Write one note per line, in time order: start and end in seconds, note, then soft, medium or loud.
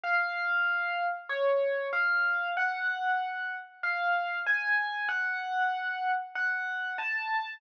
0.04 1.04 F5 medium
1.29 1.87 C#5 medium
1.93 2.50 F5 medium
2.57 3.55 F#5 medium
3.83 4.39 F5 medium
4.46 5.08 G#5 medium
5.09 6.11 F#5 medium
6.35 6.94 F#5 medium
6.98 7.54 A5 medium